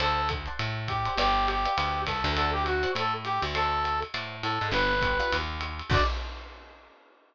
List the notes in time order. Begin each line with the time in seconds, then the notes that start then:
0.00 D2 A4 C5 D5 F#5 A5, ride
0.29 kick, hi-hat pedal, ride
0.46 C5 D5 F#5 A5, ride
0.59 A2, ride
0.88 G4, kick, hi-hat pedal, ride
1.05 C5 D5 F#5 A5, ride
1.17 G1 G4 B4 D5 F5 G5, ride
1.48 G4, hi-hat pedal, ride
1.65 B4 D5 F5 G5, ride
1.77 D2 B4 D5 F5 G5, ride
2.07 C2 A4 B4 D5 F5 G5, kick, hi-hat pedal, ride
2.24 D2 B4 D5 F5 G5, ride
2.36 A4 C5 D5 F#5 A5, ride
2.53 G4
2.66 F#4, hi-hat pedal, ride
2.83 C5 D5 F#5 A5, ride
2.95 A2 A4, ride
3.25 G4, hi-hat pedal, ride
3.42 D2, ride
3.55 A4 C5 D5 F#5 A5, ride
3.84 hi-hat pedal, ride
4.02 ride
4.14 A2 C5 D5 F#5 A5, ride
4.43 A2 A4, hi-hat pedal, ride
4.61 G#2 C5 D5 F#5 A5, ride
4.71 G1 B3 D4 F4 G4 B4, ride
5.01 B3 D4 F4 G4, kick, hi-hat pedal, ride
5.20 B3 D4 F4 G4, ride
5.32 D#2, ride
5.61 hi-hat pedal, ride
5.79 ride
5.90 D2 C4 D4 F#4 A4 D5, kick, crash